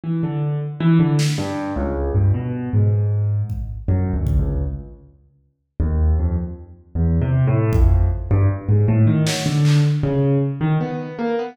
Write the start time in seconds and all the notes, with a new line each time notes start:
0.04 E3
0.23 D3
0.80 E3
0.99 D3
1.19 snare
1.38 G2
1.76 C#2
2.15 G2
2.34 B2
2.73 G#2
3.50 kick
3.88 F#2
4.13 D2
4.27 kick
4.39 C#2
5.80 D#2
6.19 F2
6.95 E2
7.22 C3
7.47 A2
7.73 F2, kick
8.31 G2
8.69 G#2
8.88 A2
9.07 D#3
9.27 F#3, snare
9.46 D3
9.65 clap
10.03 C#3
10.61 D#3
10.80 B3
11.19 A#3
11.39 B3